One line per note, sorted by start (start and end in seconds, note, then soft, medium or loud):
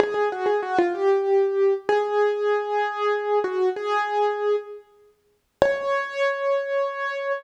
0.00 0.14 G#4 loud
0.14 0.29 G#4 medium
0.32 0.47 F#4 loud
0.46 0.61 G#4 medium
0.62 0.77 F#4 loud
0.79 0.93 F4 loud
0.95 1.74 G4 medium
1.89 3.39 G#4 loud
3.44 3.69 F#4 loud
3.76 4.56 G#4 loud
5.62 7.32 C#5 loud